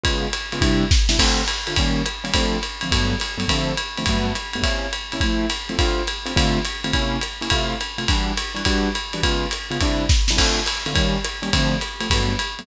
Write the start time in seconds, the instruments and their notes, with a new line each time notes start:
0.04 acoustic grand piano C#3 G#3 B3 F4, kick, ride
0.33 hi-hat pedal, ride
0.52 acoustic grand piano C#3 G#3 B3 F4, ride
0.61 acoustic grand piano C3 G3 D4 E4, kick, ride
0.91 kick, snare
1.09 acoustic grand piano C3 G3 D4 E4, snare
1.19 acoustic grand piano D3 A3 C4 F4, kick, crash, ride
1.48 hi-hat pedal, ride
1.67 acoustic grand piano D3 A3 C4 F4, ride
1.76 acoustic grand piano D#3 G3 A#3 C#4, kick, ride
2.06 hi-hat pedal, ride
2.24 acoustic grand piano D#3 G3 A#3 C#4, ride
2.34 acoustic grand piano D3 F3 A3 C4, kick, ride
2.63 hi-hat pedal, ride
2.81 acoustic grand piano D3 F3 A3 C4, ride
2.91 acoustic grand piano G2 F#3 A3 B3, kick, ride
3.20 hi-hat pedal, ride
3.38 acoustic grand piano G2 F#3 A3 B3, ride
3.48 acoustic grand piano D3 F3 A3 C4, kick, ride
3.77 hi-hat pedal, ride
3.97 acoustic grand piano D3 F3 A3 C4, ride
4.06 acoustic grand piano G2 F#3 A3 B3, kick, ride
4.35 hi-hat pedal, ride
4.53 acoustic grand piano G2 F#3 A3 B3, ride
4.63 acoustic grand piano C3 A#3 C#4 E4, kick, ride
4.93 hi-hat pedal, ride
5.12 acoustic grand piano C3 A#3 C#4 E4, ride
5.20 acoustic grand piano F3 A3 C4 E4, kick, ride
5.50 hi-hat pedal, ride
5.69 acoustic grand piano F3 A3 C4 E4, ride
5.79 acoustic grand piano D3 A3 C4 F4, kick, ride
6.07 hi-hat pedal, ride
6.26 acoustic grand piano D3 A3 C4 F4, ride
6.36 acoustic grand piano D3 A3 C4 F4, kick, ride
6.65 hi-hat pedal, ride
6.84 acoustic grand piano D3 A3 C4 F4, ride
6.93 acoustic grand piano C3 A#3 C#4 E4, kick, ride
7.21 hi-hat pedal, ride
7.41 acoustic grand piano C3 A#3 C#4 E4, ride
7.50 acoustic grand piano C3 A3 E4 F4, kick, ride
7.81 hi-hat pedal, ride
7.98 acoustic grand piano C3 A3 E4 F4, ride
8.08 acoustic grand piano E3 G3 D4 F#4, kick, ride
8.37 hi-hat pedal, ride
8.55 acoustic grand piano E3 G3 D4 F#4, ride
8.65 acoustic grand piano E3 G3 D4 F#4, kick, ride
8.95 hi-hat pedal, ride
9.13 acoustic grand piano E3 G3 D4 F#4, ride
9.23 acoustic grand piano C#3 G#3 B3 F4, kick, ride
9.51 hi-hat pedal, ride
9.71 acoustic grand piano C#3 G#3 B3 F4, ride
9.81 acoustic grand piano C3 G3 D4 E4, kick, ride
10.09 kick, snare
10.28 acoustic grand piano C3 G3 D4 E4, snare
10.37 acoustic grand piano D3 A3 C4 F4, kick, crash, ride
10.66 hi-hat pedal, ride
10.86 acoustic grand piano D3 A3 C4 F4, ride
10.93 acoustic grand piano D#3 G3 A#3 C#4, kick, ride
11.25 hi-hat pedal, ride
11.42 acoustic grand piano D#3 G3 A#3 C#4, ride
11.53 acoustic grand piano D3 F3 A3 C4, kick, ride
11.81 hi-hat pedal, ride
12.01 acoustic grand piano D3 F3 A3 C4, ride
12.10 acoustic grand piano G2 F#3 A3 B3, kick, ride
12.39 hi-hat pedal, ride
12.59 acoustic grand piano G2 F#3 A3 B3, ride